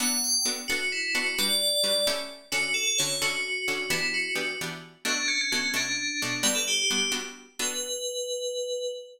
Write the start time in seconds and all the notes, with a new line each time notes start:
0.00 B3 D4 F#4 A4 F#5
0.24 G5
0.45 B3 D4 F#4 A4
0.68 B3 D4 F#4 A4
0.92 E4
1.15 B3 D4 F#4 A4
1.39 G3 D4 F#4 B4 D5
1.83 G3 D4 F#4 B4
2.07 A3 C#4 E4 G4
2.52 D3 C#4 F#4 A4
2.74 A4
2.87 A4
2.98 D3 C#4 F#4 A4 C#5
3.22 D3 C#4 F#4 A4
3.68 D3 C#4 F#4 A4
3.90 E3 B3 D4 E4 G4
4.14 F#4
4.35 E3 B3 D4 G4
4.61 E3 B3 D4 G4
5.05 B2 A3 D4 F#4
5.28 C#4
5.41 C#4
5.52 B2 A3 C#4 D4 F#4
5.74 B2 A3 D4 F#4
6.22 B2 A3 D4 F#4
6.43 G3 B3 D4 F#4 B4
6.55 A4
6.68 G4
6.90 G3 B3 D4 F#4
7.12 G3 B3 D4 F#4
7.59 B3 D4 F#4 A4 B4